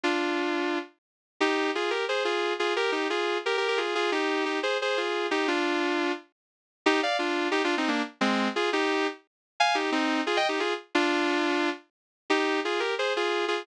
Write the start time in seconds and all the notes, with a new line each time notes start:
0.03 D4 F4
1.40 D#4 G4
1.75 F4 G#4
1.90 G4 A#4
2.09 G#4 C5
2.25 F4 G#4
2.59 F4 G#4
2.76 G4 A#4
2.92 D#4 G4
3.10 F4 G#4
3.46 G4 A#4
3.57 G4 A#4
3.68 G4 A#4
3.77 F4 G#4
3.95 F4 G#4
4.12 D#4 G4
4.45 D#4 G4
4.63 G#4 C5
4.82 G#4 C5
4.97 F4 G#4
5.31 D#4 G4
5.48 D4 F4
6.86 D#4 G4
7.03 D5 F5
7.19 D4 F4
7.51 D#4 G4
7.64 D4 F4
7.77 C4 D#4
7.88 A#3 D4
8.21 G#3 C4
8.56 F4 G#4
8.73 D#4 G4
9.60 F5 G#5
9.75 D#4 G4
9.92 C4 D#4
10.27 F4 G#4
10.37 D#5 G5
10.49 D#4 G4
10.60 F4 G#4
10.95 D4 F4
12.30 D#4 G4
12.65 F4 G#4
12.80 G4 A#4
12.99 G#4 C5
13.16 F4 G#4
13.48 F4 G#4